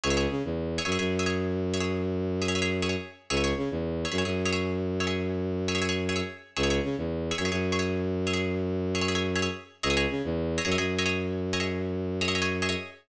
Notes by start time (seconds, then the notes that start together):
0.04 C#2 G#4 C#5 E5
0.10 G#4 C#5 E5
0.17 G#4 C#5 E5
0.31 C#3
0.45 E2
0.78 G#4 C#5 E5
0.85 F#2 G#4 C#5 E5
0.92 G#4 C#5 E5
0.99 F#2 G#4 C#5 E5
1.19 G#4 C#5 E5
1.26 G#4 C#5 E5
1.74 G#4 C#5 E5
1.80 G#4 C#5 E5
2.42 G#4 C#5 E5
2.48 G#4 C#5 E5
2.55 G#4 C#5 E5
2.62 G#4 C#5 E5
2.82 G#4 C#5 E5
2.89 G#4 C#5 E5
3.30 C#2 G#4 C#5 E5
3.37 G#4 C#5 E5
3.44 G#4 C#5 E5
3.57 C#3
3.71 E2
4.05 G#4 C#5 E5
4.12 F#2 G#4 C#5 E5
4.18 G#4 C#5 E5
4.25 F#2 G#4 C#5 E5
4.45 G#4 C#5 E5
4.52 G#4 C#5 E5
5.00 G#4 C#5 E5
5.07 G#4 C#5 E5
5.68 G#4 C#5 E5
5.75 G#4 C#5 E5
5.82 G#4 C#5 E5
5.89 G#4 C#5 E5
6.09 G#4 C#5 E5
6.16 G#4 C#5 E5
6.57 C#2 G#4 C#5 E5
6.63 G#4 C#5 E5
6.70 G#4 C#5 E5
6.84 C#3
6.98 E2
7.31 G#4 C#5 E5
7.38 F#2 G#4 C#5 E5
7.45 G#4 C#5 E5
7.51 F#2 G#4 C#5 E5
7.72 G#4 C#5 E5
7.79 G#4 C#5 E5
8.27 G#4 C#5 E5
8.33 G#4 C#5 E5
8.95 G#4 C#5 E5
9.01 G#4 C#5 E5
9.08 G#4 C#5 E5
9.15 G#4 C#5 E5
9.35 G#4 C#5 E5
9.42 G#4 C#5 E5
9.83 C#2 G#4 C#5 D#5 E5
9.90 G#4 C#5 D#5 E5
9.97 G#4 C#5 D#5 E5
10.10 C#3
10.24 E2
10.58 G#4 C#5 D#5 E5
10.65 F#2 G#4 C#5 D#5 E5
10.72 G#4 C#5 D#5 E5
10.78 F#2 G#4 C#5 D#5 E5
10.99 G#4 C#5 D#5 E5
11.06 G#4 C#5 D#5 E5
11.53 G#4 C#5 D#5 E5
11.60 G#4 C#5 D#5 E5
12.21 G#4 C#5 D#5 E5
12.28 G#4 C#5 D#5 E5
12.35 G#4 C#5 D#5 E5
12.42 G#4 C#5 D#5 E5
12.62 G#4 C#5 D#5 E5
12.69 G#4 C#5 D#5 E5